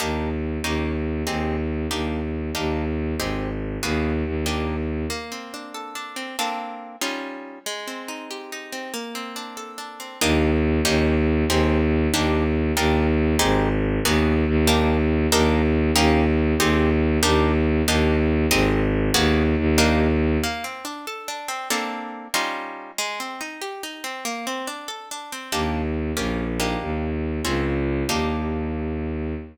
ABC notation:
X:1
M:6/8
L:1/8
Q:3/8=94
K:Ebmix
V:1 name="Orchestral Harp"
[B,=DEG]3 [B,_DEG]3 | [CEGA]3 [B,=DEG]3 | [B,=DEG]3 [CEGA]3 | [B,_C_GA]3 [B,=DE=G]3 |
[K:Bbmix] B, C D =A D C | [B,CD=A]3 [G,_DEF]3 | A, C E G E C | B, C D =A D C |
[K:Ebmix] [B,=DEG]3 [B,_DEG]3 | [CEGA]3 [B,=DEG]3 | [B,=DEG]3 [CEGA]3 | [B,_C_GA]3 [B,=DE=G]3 |
[B,=DEG]3 [B,_DEG]3 | [CEGA]3 [B,=DEG]3 | [B,=DEG]3 [CEGA]3 | [B,_C_GA]3 [B,=DE=G]3 |
[K:Bbmix] B, C D =A D C | [B,CD=A]3 [G,_DEF]3 | A, C E G E C | B, C D =A D C |
[K:Ebmix] [B,=DEG]3 [B,_DFG]2 [B,=DEG]- | [B,=DEG]3 [C_DFA]3 | [B,=DEG]6 |]
V:2 name="Violin" clef=bass
E,,3 E,,3 | E,,3 E,,3 | E,,3 A,,,3 | E,,2 E,,4 |
[K:Bbmix] z6 | z6 | z6 | z6 |
[K:Ebmix] E,,3 E,,3 | E,,3 E,,3 | E,,3 A,,,3 | E,,2 E,,4 |
E,,3 E,,3 | E,,3 E,,3 | E,,3 A,,,3 | E,,2 E,,4 |
[K:Bbmix] z6 | z6 | z6 | z6 |
[K:Ebmix] E,,3 B,,,3 | E,,3 D,,3 | E,,6 |]